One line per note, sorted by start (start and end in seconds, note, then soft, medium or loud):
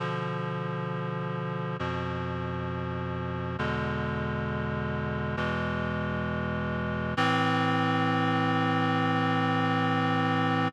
0.00 1.77 B2 medium
0.00 1.77 D3 medium
0.00 1.77 F3 medium
1.79 3.57 F2 medium
1.79 3.57 B2 medium
1.79 3.57 F3 medium
3.59 5.36 E2 medium
3.59 5.36 B2 medium
3.59 5.36 D3 medium
3.59 5.36 G#3 medium
5.37 7.14 E2 medium
5.37 7.14 B2 medium
5.37 7.14 E3 medium
5.37 7.14 G#3 medium
7.17 10.68 A2 loud
7.17 10.68 E3 loud
7.17 10.68 C4 loud